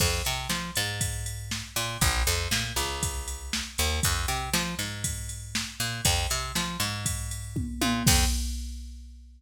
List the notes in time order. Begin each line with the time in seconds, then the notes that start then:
0.00 F2, kick, crash
0.25 C3, ride
0.49 F3, snare
0.76 G#2, ride
1.01 kick, ride
1.26 ride
1.51 snare
1.76 A#2, ride
2.01 A#1, kick, ride
2.27 F2, ride
2.51 A#2, snare
2.76 C#2, ride
3.03 kick, ride
3.28 ride
3.53 snare
3.78 D#2, ride
4.03 F2, kick, ride
4.28 C3, ride
4.53 F3, snare
4.79 G#2, ride
5.04 kick, ride
5.29 ride
5.55 snare
5.80 A#2, ride
6.05 F2, kick, ride
6.30 C3, ride
6.55 F3, snare
6.80 G#2, ride
7.06 kick, ride
7.31 ride
7.56 kick, high tom
7.82 A#2, high tom
8.07 F2, kick, crash